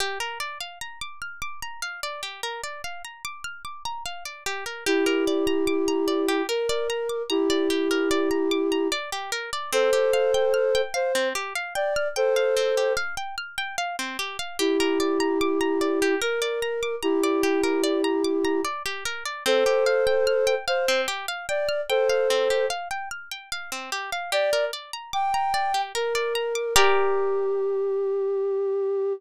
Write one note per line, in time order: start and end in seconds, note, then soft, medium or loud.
0.00 0.18 G4 medium
0.20 0.38 A#4 medium
0.40 0.58 D5 medium
0.60 0.79 F5 medium
0.81 0.99 A#5 medium
1.01 1.20 D6 medium
1.22 1.40 F6 medium
1.42 1.60 D6 medium
1.62 1.81 A#5 medium
1.82 2.01 F5 medium
2.03 2.21 D5 medium
2.23 2.41 G4 soft
2.43 2.61 A#4 medium
2.64 2.82 D5 medium
2.84 3.02 F5 medium
3.05 3.23 A#5 soft
3.25 3.43 D6 medium
3.44 3.63 F6 medium
3.65 3.83 D6 medium
3.85 4.04 A#5 medium
4.06 4.24 F5 medium
4.25 4.44 D5 soft
4.46 4.64 G4 medium
4.66 4.84 A#4 medium
4.86 6.42 E4 medium
4.86 6.42 G4 medium
4.86 5.05 G4 medium
5.06 5.24 A#4 medium
5.27 5.46 D5 medium
5.47 5.65 A#5 medium
5.67 5.85 D6 medium
5.88 6.06 A#5 medium
6.08 6.26 D5 medium
6.28 6.47 G4 medium
6.49 7.22 A#4 medium
6.49 6.67 A#4 medium
6.69 6.88 D5 medium
6.90 7.08 A#5 medium
7.09 7.28 D6 medium
7.30 8.88 E4 medium
7.30 8.88 G4 medium
7.30 7.48 A#5 medium
7.50 7.68 D5 medium
7.70 7.88 G4 medium
7.91 8.09 A#4 medium
8.11 8.29 D5 medium
8.31 8.49 A#5 medium
8.51 8.70 D6 medium
8.72 8.90 A#5 medium
8.92 9.10 D5 medium
9.12 9.31 G4 medium
9.32 9.50 A#4 medium
9.53 9.71 D5 medium
9.72 9.91 C4 medium
9.72 10.81 A4 medium
9.72 10.81 C5 loud
9.93 10.11 G4 medium
10.13 10.32 F5 medium
10.34 10.53 G5 medium
10.54 10.72 F6 medium
10.75 10.93 G5 medium
10.94 11.28 C5 medium
10.94 11.12 F5 medium
11.15 11.33 C4 medium
11.35 11.53 G4 medium
11.55 11.74 F5 medium
11.75 12.08 D5 medium
11.75 11.94 G5 medium
11.96 12.15 F6 medium
12.16 12.93 A4 medium
12.16 12.93 C5 medium
12.16 12.34 G5 medium
12.36 12.55 F5 medium
12.57 12.75 C4 medium
12.77 12.96 G4 medium
12.97 13.15 F5 medium
13.17 13.35 G5 medium
13.38 13.56 F6 medium
13.58 13.76 G5 medium
13.78 13.96 F5 medium
13.99 14.17 C4 medium
14.19 14.37 G4 medium
14.39 14.57 F5 medium
14.59 16.15 E4 medium
14.59 14.77 G4 medium
14.59 16.15 G4 medium
14.80 14.98 A#4 medium
15.00 15.18 D5 medium
15.20 15.38 A#5 medium
15.41 15.59 D6 medium
15.61 15.79 A#5 medium
15.81 15.99 D5 medium
16.02 16.20 G4 medium
16.21 16.40 A#4 medium
16.21 16.95 A#4 medium
16.42 16.60 D5 medium
16.62 16.81 A#5 medium
16.83 17.01 D6 medium
17.03 18.61 E4 medium
17.03 18.61 G4 medium
17.03 17.21 A#5 medium
17.23 17.42 D5 medium
17.43 17.61 G4 medium
17.64 17.82 A#4 medium
17.84 18.02 D5 medium
18.04 18.22 A#5 medium
18.24 18.43 D6 medium
18.45 18.63 A#5 medium
18.65 18.83 D5 medium
18.86 19.04 G4 medium
19.05 19.24 A#4 medium
19.26 19.44 D5 medium
19.46 19.64 C4 medium
19.46 20.55 A4 medium
19.46 20.55 C5 loud
19.66 19.84 G4 medium
19.86 20.05 F5 medium
20.07 20.25 G5 medium
20.27 20.45 F6 medium
20.47 20.65 G5 medium
20.68 21.01 C5 medium
20.68 20.86 F5 medium
20.88 21.07 C4 medium
21.08 21.26 G4 medium
21.28 21.46 F5 medium
21.49 21.81 D5 medium
21.49 21.67 G5 medium
21.69 21.87 F6 medium
21.89 22.66 A4 medium
21.89 22.66 C5 medium
21.89 22.08 G5 medium
22.09 22.28 F5 medium
22.30 22.48 C4 medium
22.50 22.69 G4 medium
22.70 22.88 F5 medium
22.91 23.09 G5 medium
23.11 23.29 F6 medium
23.31 23.50 G5 medium
23.52 23.70 F5 medium
23.72 23.90 C4 medium
23.92 24.10 G4 medium
24.12 24.31 F5 medium
24.32 24.50 G4 medium
24.32 24.65 D5 loud
24.53 24.71 A#4 medium
24.73 24.91 D5 medium
24.93 25.11 A#5 medium
25.13 25.81 G5 medium
25.13 25.31 D6 medium
25.34 25.52 A#5 medium
25.54 25.72 D5 medium
25.74 25.92 G4 medium
25.95 26.74 A#4 medium
25.95 26.13 A#4 medium
26.15 26.33 D5 medium
26.35 26.53 A#5 medium
26.55 26.73 D6 medium
26.76 29.13 G4 loud
26.76 29.13 A#4 loud
26.76 29.13 D5 loud